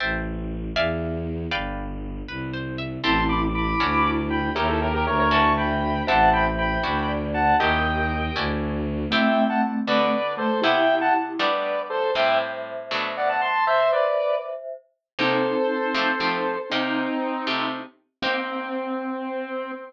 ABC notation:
X:1
M:6/8
L:1/16
Q:3/8=79
K:Ador
V:1 name="Lead 1 (square)"
z12 | z12 | [ac']2 [bd'] z [bd']5 z [gb]2 | [G_B] [_FA] [GB] [GB] [B_d] [Bd] [a^c']2 [g=b]4 |
[fa]2 [gb] z [gb]5 z [fa]2 | [_eg]8 z4 | [eg]3 [fa] z2 [Bd]4 [Ac]2 | [eg]3 [fa] z2 [Bd]4 [Ac]2 |
[eg]2 z6 [df] [fa] [ac']2 | [ce]2 [Bd]4 z6 | [K:Cdor] [Ac]12 | [CE]8 z4 |
C12 |]
V:2 name="Glockenspiel"
z12 | z12 | [CE]4 E4 E4 | [_d_f]4 f4 e4 |
[ce]8 d4 | [G_B]8 z4 | [A,C]10 A,2 | [EG]8 z4 |
[ce]12 | [ce]10 z2 | [K:Cdor] [CE]12 | [CE]10 z2 |
C12 |]
V:3 name="Acoustic Guitar (steel)"
[cega]6 [de=f^g]6 | [Bd=fg]6 B2 c2 e2 | [CEGA]6 [^CDEF]6 | [_D_E_FG]6 [^C=D=E^F]6 |
[CEGA]6 [^CDEF]6 | [_D_E_FG]6 [^C=D=E^F]6 | [A,CEG]6 [D,B,FA]6 | [C,B,EG]6 [G,A,B,D]6 |
[A,,G,CE]6 [B,,F,A,D]6 | z12 | [K:Cdor] [C,B,EG]6 [F,A,CG]2 [F,A,CG]4 | [C,B,EG]6 [C,A,FG]6 |
[B,CEG]12 |]
V:4 name="Violin" clef=bass
A,,,6 E,,6 | G,,,6 C,,6 | A,,,6 D,,6 | _E,,4 D,,8 |
A,,,6 D,,6 | _E,,6 D,,6 | z12 | z12 |
z12 | z12 | [K:Cdor] z12 | z12 |
z12 |]